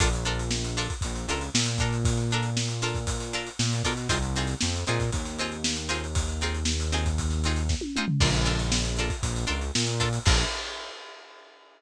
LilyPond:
<<
  \new Staff \with { instrumentName = "Pizzicato Strings" } { \time 4/4 \key bes \mixolydian \tempo 4 = 117 <d' f' a' bes'>8 <d' f' a' bes'>4 <d' f' a' bes'>4 <d' f' a' bes'>4 <d' f' a' bes'>8~ | <d' f' a' bes'>8 <d' f' a' bes'>4 <d' f' a' bes'>4 <d' f' a' bes'>4 <d' f' a' bes'>8 | <c' ees' f' aes'>8 <c' ees' f' aes'>4 <c' ees' f' aes'>4 <c' ees' f' aes'>4 <c' ees' f' aes'>8~ | <c' ees' f' aes'>8 <c' ees' f' aes'>4 <c' ees' f' aes'>4 <c' ees' f' aes'>4 <c' ees' f' aes'>8 |
<d' f' a' bes'>8 <d' f' a' bes'>4 <d' f' a' bes'>4 <d' f' a' bes'>4 <d' f' a' bes'>8 | <d' f' a' bes'>4 r2. | }
  \new Staff \with { instrumentName = "Synth Bass 1" } { \clef bass \time 4/4 \key bes \mixolydian bes,,2 bes,,8 des,8 bes,4~ | bes,2. bes,8 b,8 | c,4 f,8 bes,8 ees,2~ | ees,1 |
bes,,2 bes,,8 des,8 bes,4 | bes,,4 r2. | }
  \new DrumStaff \with { instrumentName = "Drums" } \drummode { \time 4/4 <hh bd>16 hh16 hh16 hh16 sn16 hh16 hh16 <hh bd>16 <hh bd>16 hh16 hh16 hh16 sn16 hh16 <hh bd>16 hh16 | <hh bd>16 <hh sn>16 hh16 hh16 sn16 <hh sn>16 hh16 <hh bd sn>16 <hh bd>16 hh16 hh16 hh16 sn16 <hh sn>16 <hh bd sn>16 <hh sn>16 | <hh bd>16 hh16 hh16 <hh sn>16 sn16 hh16 hh16 <hh bd sn>16 <hh bd>16 <hh sn>16 hh16 hh16 sn16 hh16 hh16 hh16 | <hh bd>16 hh16 hh16 hh16 sn16 hh16 hh16 <hh bd>16 <hh bd>16 <hh sn>16 hh16 hh16 <bd sn>16 tommh16 toml16 tomfh16 |
<cymc bd>16 <hh sn>16 <hh sn>16 hh16 sn16 hh16 hh16 <hh bd>16 <hh bd>16 hh16 hh16 hh16 sn16 hh16 <hh bd>16 hh16 | <cymc bd>4 r4 r4 r4 | }
>>